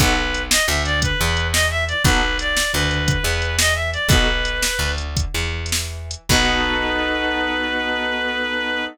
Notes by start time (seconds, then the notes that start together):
0.00 B1 B3 D#4 F#4 A4 B4, kick, closed hi-hat
0.34 closed hi-hat
0.50 D#5, snare
0.67 D2 D3 E5
0.85 D5, closed hi-hat
1.02 B4, kick, closed hi-hat
1.20 E2 E3
1.37 closed hi-hat
1.52 D#5, snare
1.71 E5
1.88 D5, closed hi-hat
2.04 B1 B3 D#4 F#4 A4 B4, kick, closed hi-hat
2.39 D5, closed hi-hat
2.57 snare
2.73 D2 D3 B4
2.91 closed hi-hat
3.08 kick, closed hi-hat
3.23 E2 E3
3.42 closed hi-hat
3.59 D#5, snare
3.75 E5
3.93 D5, closed hi-hat
4.08 B1 B3 D#4 F#4 A4 B4, kick, closed hi-hat
4.45 closed hi-hat
4.62 snare
4.79 D2 D3
4.98 closed hi-hat
5.17 kick, closed hi-hat
5.34 E2 E3
5.66 closed hi-hat
5.72 snare
6.11 closed hi-hat
6.29 B1 B3 D#4 F#4 A4 B4, kick, crash